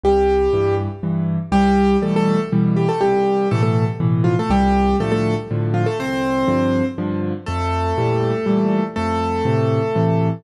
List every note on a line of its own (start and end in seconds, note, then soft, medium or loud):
0.04 0.48 C2 medium
0.04 0.75 G3 loud
0.04 0.75 G4 loud
0.53 0.88 G2 medium
0.53 0.88 E3 medium
1.03 1.38 G2 medium
1.03 1.38 E3 medium
1.52 1.96 C2 medium
1.52 1.97 G3 loud
1.52 1.97 G4 loud
2.02 2.37 B2 medium
2.02 2.37 E3 medium
2.02 2.37 G3 medium
2.02 2.14 A3 medium
2.02 2.14 A4 medium
2.16 2.40 A3 loud
2.16 2.40 A4 loud
2.52 2.87 B2 medium
2.52 2.87 E3 medium
2.52 2.87 G3 medium
2.76 2.88 G3 medium
2.76 2.88 G4 loud
2.89 3.01 A3 medium
2.89 3.01 A4 loud
3.01 3.46 C2 medium
3.01 3.48 G3 medium
3.01 3.48 G4 loud
3.51 3.87 A2 medium
3.51 3.87 B2 medium
3.51 3.87 E3 medium
3.51 3.62 A3 loud
3.51 3.62 A4 loud
3.63 3.85 A3 medium
3.63 3.85 A4 loud
4.00 4.35 A2 medium
4.00 4.35 B2 medium
4.00 4.35 E3 medium
4.24 4.36 F3 medium
4.24 4.36 F4 loud
4.39 4.51 A3 medium
4.39 4.51 A4 loud
4.50 4.94 C2 medium
4.50 4.96 G3 loud
4.50 4.96 G4 loud
5.00 5.35 A2 medium
5.00 5.35 D3 medium
5.00 5.35 F3 medium
5.00 5.11 A3 loud
5.00 5.11 A4 loud
5.12 5.34 A3 loud
5.12 5.34 A4 loud
5.51 5.85 A2 medium
5.51 5.85 D3 medium
5.51 5.85 F3 medium
5.74 5.86 F3 medium
5.74 5.86 F4 medium
5.86 5.98 A3 medium
5.86 5.98 A4 loud
5.99 6.44 C2 medium
5.99 6.85 C4 loud
5.99 6.85 C5 loud
6.48 6.82 G2 medium
6.48 6.82 D3 medium
6.48 6.82 F3 medium
6.98 7.33 G2 medium
6.98 7.33 D3 medium
6.98 7.33 F3 medium
7.46 7.93 F2 medium
7.46 8.84 A3 loud
7.46 8.84 A4 loud
7.98 8.32 A#2 medium
7.98 8.32 E3 medium
7.98 8.32 G3 medium
8.46 8.81 A#2 medium
8.46 8.81 E3 medium
8.46 8.81 G3 medium
8.96 9.42 F2 medium
8.96 10.28 A3 loud
8.96 10.28 A4 loud
9.45 9.80 A2 medium
9.45 9.80 C3 medium
9.45 9.80 E3 medium
9.95 10.30 A2 medium
9.95 10.30 C3 medium
9.95 10.30 E3 medium